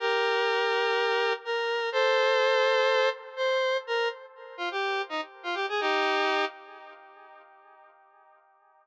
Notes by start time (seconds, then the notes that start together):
0.00 G4 A#4
1.45 A#4
1.92 A4 C5
3.37 C5
3.87 A#4
4.57 F4
4.71 G4
5.09 D#4
5.43 F4
5.55 G4
5.69 G#4
5.80 D#4 G4